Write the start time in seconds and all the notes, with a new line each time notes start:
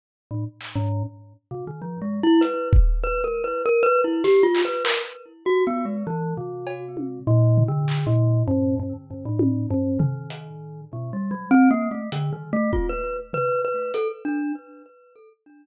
0.31 A2
0.61 clap
0.75 G#2
1.51 C3
1.67 D#3
1.82 F3
2.02 G#3
2.23 E4
2.41 B4, closed hi-hat
2.73 kick
3.03 B4
3.24 A#4
3.44 B4
3.65 A#4
3.83 B4
4.04 E4
4.24 G4, snare
4.43 F4
4.55 clap
4.65 B4
4.84 A#4, clap
5.46 F#4
5.67 B3
5.85 G#3
6.07 E3
6.37 C3
6.67 cowbell
6.97 high tom
7.27 A#2
7.58 floor tom
7.68 D3
7.88 clap
8.06 A#2
8.47 G2
8.79 G2
9.10 G2
9.25 A2
9.39 high tom
9.70 G2
9.99 D#3, floor tom
10.30 closed hi-hat
10.93 B2
11.13 G3
11.31 F#3
11.51 C4
11.71 A#3
11.91 A3
12.12 D3, closed hi-hat
12.32 D#3
12.53 A3
12.73 F4, kick
12.89 B4
13.33 B4, floor tom
13.65 B4
13.94 A4, closed hi-hat
14.25 D4